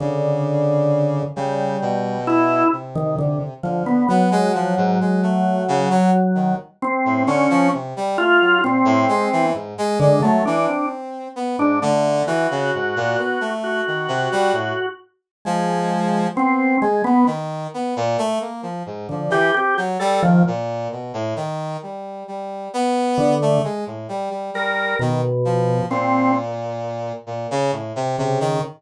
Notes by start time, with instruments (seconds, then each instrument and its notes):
0.00 brass section C#3, drawbar organ D3
1.36 brass section C#3, drawbar organ G3
1.81 brass section B2
2.27 drawbar organ E4
2.72 brass section C3
2.95 drawbar organ D#3
3.19 drawbar organ D3
3.63 brass section D3, drawbar organ F3
3.86 drawbar organ B3
4.09 drawbar organ F#3, brass section B3
4.31 brass section G#3
4.54 brass section F3
4.77 brass section G#2
5.01 brass section G#3
5.23 brass section A3
5.68 brass section C#3
5.90 brass section F#3
6.35 brass section D#3
6.82 drawbar organ C4
7.05 brass section A2
7.27 brass section D3, drawbar organ C#4
7.50 brass section F3
7.73 brass section C3
7.96 brass section G3
8.18 brass section A3, drawbar organ F4
8.41 brass section F#3
8.63 brass section A#2, drawbar organ C4
8.85 brass section A2
9.09 brass section G#3
9.32 brass section E3
9.54 brass section G#2
9.78 brass section G#3
10.00 drawbar organ D3, brass section G#3
10.22 brass section F#3, drawbar organ A3
10.45 brass section E3, drawbar organ D4
10.67 brass section C4
11.36 brass section B3
11.58 brass section G#2, drawbar organ D4
11.82 brass section D3, drawbar organ A3
12.27 brass section E3, drawbar organ F#4
12.51 brass section C#3
12.74 brass section G#2
12.96 brass section A#2
13.18 brass section B3
13.41 brass section A3
13.64 drawbar organ F#4
13.87 brass section D#3
14.08 brass section C3
14.32 brass section G3
14.53 brass section A2
15.45 brass section F3, drawbar organ G#3
16.35 brass section B3, drawbar organ C4
16.81 brass section G#3, drawbar organ G#3
17.04 drawbar organ B3, brass section B3
17.26 brass section D#3
17.74 brass section B3
17.96 brass section A#2
18.18 brass section A3
18.41 brass section A#3
18.63 brass section F3
18.86 brass section G#2
19.09 drawbar organ D3, brass section F3
19.30 brass section E3, drawbar organ G4
19.54 brass section C4, drawbar organ G4
19.77 brass section F#3
20.00 brass section G3, drawbar organ A4
20.23 brass section D#3, drawbar organ F3
20.47 brass section A#2
20.92 brass section B2
21.14 brass section A2
21.36 brass section D#3
21.83 brass section G3
22.28 brass section G3
22.73 brass section B3
23.18 drawbar organ D3
23.42 brass section A3
23.64 brass section G#3
23.87 brass section A2
24.09 brass section G3
24.30 brass section G3
24.54 brass section G3, drawbar organ A#4
24.99 drawbar organ B2, brass section D#3
25.45 brass section F3
25.90 brass section A#2, drawbar organ C4
27.27 brass section A#2
27.51 brass section C#3
27.72 brass section A2
27.96 brass section C3
28.18 brass section C3, drawbar organ C#3
28.40 brass section D#3